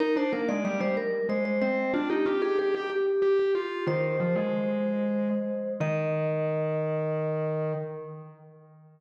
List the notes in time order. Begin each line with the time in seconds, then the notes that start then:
0.00 D#4 A#4
0.16 D4 C5
0.33 A#3 A#4
0.49 G#3 D5
0.65 G3 D5
0.80 G3 C5
0.97 A#4
1.29 G#3 C5
1.45 C5
1.61 C4 C5
1.94 D4 F4
2.10 D#4 G4
2.26 F4 G4
2.42 G4 G#4
2.59 G4 G#4
2.74 G4
2.90 G4
3.22 G4
3.39 G4
3.55 F4 G4
3.87 D#3 C5
4.20 F3
4.35 G#3
5.80 D#3 D#5